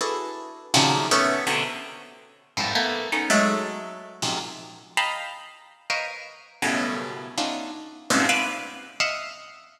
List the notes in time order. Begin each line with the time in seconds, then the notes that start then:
0.01 D4 E4 F#4 G#4 A4 B4
0.74 A#2 C3 C#3 D#3 F3 F#3
1.11 A3 B3 C#4
1.47 B2 C3 D3
2.57 F2 G2 G#2 A2
2.75 A3 A#3 B3
3.12 A3 B3 C#4 D#4
3.30 F#3 G#3 A3
4.22 F2 F#2 G#2 A#2 C3
4.97 D#5 F5 G5 A5 A#5 B5
5.90 A#4 B4 C5 C#5 D#5 F5
6.62 F#2 G2 A2 B2 C#3
7.38 A3 B3 C#4 D4 D#4 F4
8.10 G2 G#2 A#2 B2 C3 C#3
8.29 B4 C5 D5 E5 F5
9.00 D#5 E5 F5 F#5